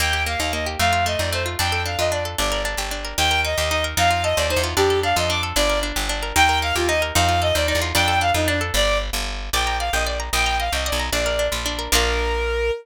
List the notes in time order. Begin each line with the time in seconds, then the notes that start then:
0.00 D#2 A#3 G5
0.13 G4
0.26 A#3 F5
0.39 D#2 D#4 F5
0.53 A#3 D#5
0.66 G4
0.79 F2 A3 F5
0.93 F4
1.06 A3 D#5
1.19 F2 D#4 D5
1.33 A3 C5
1.46 F4
1.59 F2 D4 G5
1.72 A4
1.85 D4 F5
1.98 F2 F4 D#5
2.12 D4 D5
2.25 A4
2.38 G1 D4 D5
2.52 A#4
2.65 D4
2.77 G1 G4
2.91 D4
3.05 A#4
3.18 D#2 D#4 G5
3.31 A#4
3.45 D#4 D#5
3.57 D#2 G4 D#5
3.71 D#4 D#5
3.84 A#4
3.97 F2 D#4 F5
4.11 F4
4.24 A4 D#5
4.37 D#2 C5 D5
4.50 D#4 C5
4.56 E2
4.64 F4
4.76 F2 D4 G4
4.90 A4
5.03 D4 F5
5.16 F2 F4 D#5
5.30 D4 D6
5.43 A4
5.56 G1 D4 D5
5.70 A#4
5.83 D4
5.96 G1 G4
6.09 D4
6.23 A#4
6.35 D#2 D#4 G5
6.49 A#4
6.62 D#4 F5
6.75 D#2 F4 G4
6.89 D#4 D#5
7.02 A#4
7.15 F2 D#4 F5
7.29 F4
7.42 A4 D#5
7.55 D#2 C5 D5
7.68 D#4 D5
7.75 E2
7.82 F4
7.95 F2 D4 G5
8.08 A4
8.21 D4 F5
8.34 F2 D#4 F4
8.48 D4
8.61 A4
8.74 G1 D5
9.13 G1
9.53 A#1 D5 G5
9.67 A#5
9.79 D5 F5
9.93 A#1 D#5 G5
10.07 D5
10.20 A#5
10.33 A#1 D#5 G5
10.46 A#5
10.60 D#5 F5
10.72 C2 D#5 G5
10.86 D5 D#5
10.92 B1
11.00 A#5
11.12 A#1 D4 D5
11.26 A#4
11.39 D4
11.52 A#1 F4
11.66 D4
11.79 A#4
11.92 A#1 A#3 D4 F4 A#4